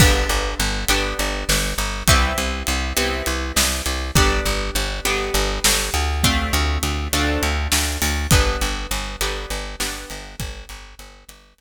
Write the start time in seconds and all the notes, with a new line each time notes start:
0.00 G1 B3 D4 G4, kick, crash
0.29 G1, closed hi-hat
0.60 G1, closed hi-hat
0.88 G1 B3 D4 G4, closed hi-hat
1.19 G1, closed hi-hat
1.49 G1, snare
1.78 G1, closed hi-hat
2.08 C2 B3 C4 E4 G4, kick, closed hi-hat
2.38 C2, closed hi-hat
2.67 C2, closed hi-hat
2.97 C2 B3 C4 E4 G4, closed hi-hat
3.26 C2, closed hi-hat
3.56 C2, snare
3.86 C2, closed hi-hat
4.15 G1 B3 D4 G4, kick, closed hi-hat
4.45 G1, closed hi-hat
4.75 G1, closed hi-hat
5.05 G1 B3 D4 G4, closed hi-hat
5.34 G1, closed hi-hat
5.64 G1, snare
5.94 D2, closed hi-hat
6.24 A3 C4 D4 F4, kick, closed hi-hat
6.53 D2, closed hi-hat
6.83 D2, closed hi-hat
7.13 D2 A3 C4 D4 F4, closed hi-hat
7.43 D2, closed hi-hat
7.72 D2, snare
8.02 D2, open hi-hat
8.31 G1 B3 D4 G4, kick, closed hi-hat
8.61 G1, closed hi-hat
8.91 G1, closed hi-hat
9.21 G1 B3 D4 G4, closed hi-hat
9.50 G1, closed hi-hat
9.80 G1 B3 D4 G4, snare
10.10 G1, closed hi-hat
10.40 G1, kick, closed hi-hat
10.69 G1, closed hi-hat
10.99 G1, closed hi-hat
11.29 G1, closed hi-hat
11.58 G1, closed hi-hat